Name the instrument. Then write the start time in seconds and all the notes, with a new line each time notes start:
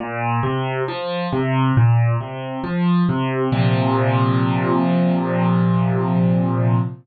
acoustic grand piano
0.00 A#2
0.43 C3
0.88 F3
1.33 C3
1.77 A#2
2.21 C3
2.64 F3
3.09 C3
3.52 A#2 C3 F3